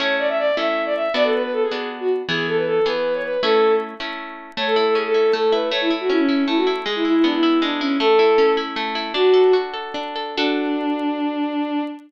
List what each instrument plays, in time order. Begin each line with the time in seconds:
0.00 orchestral harp A3 C#4 E4, violin C#5
0.19 violin D5
0.28 violin E5
0.38 violin D5
0.57 orchestral harp A3 C#4 E4, violin E5
0.85 violin D5
0.95 violin E5
1.14 orchestral harp B3 D4 F#4, violin D5
1.24 violin A4
1.34 violin B4
1.43 violin B4
1.53 violin A4
1.62 violin G#4
1.71 orchestral harp B3 D4 F#4
2.00 violin F#4
2.28 orchestral harp E3 B3 G#4, violin G#4
2.47 violin A4
2.57 violin B4
2.67 violin A4
2.86 orchestral harp E3 B3 G#4, violin B4
3.14 violin C#5
3.23 violin B4
3.43 orchestral harp A3 C#4 E4, violin A4
4.00 orchestral harp A3 C#4 E4
4.57 orchestral harp A3, violin C#5
4.67 violin A4
4.76 orchestral harp E4, violin A4
4.86 violin A4
4.95 orchestral harp C#4, violin G#4
5.05 violin A4
5.14 orchestral harp E4
5.33 orchestral harp A3, violin A4
5.52 orchestral harp E4, violin B4
5.71 orchestral harp A3, violin C#5
5.81 violin E4
5.90 orchestral harp E4
6.00 violin F#4
6.10 orchestral harp C#4, violin E4
6.19 violin C#4
6.29 orchestral harp E4
6.47 orchestral harp A3, violin E4
6.57 violin F#4
6.67 orchestral harp E4
6.86 orchestral harp G#3, violin G#4
6.95 violin E4
7.05 violin E4, orchestral harp E4
7.15 violin E4
7.24 orchestral harp B3, violin D4
7.33 violin E4
7.43 orchestral harp E4
7.62 orchestral harp G#3, violin D4
7.81 violin C#4, orchestral harp E4
8.00 orchestral harp A3, violin A4
8.19 orchestral harp E4
8.38 orchestral harp C#4
8.57 orchestral harp E4
8.76 orchestral harp A3
8.95 orchestral harp E4
9.14 orchestral harp D4, violin F#4
9.34 orchestral harp A4
9.53 orchestral harp F#4
9.74 orchestral harp A4
9.94 orchestral harp D4
10.16 orchestral harp A4
10.37 orchestral harp D4 F#4 A4, violin D4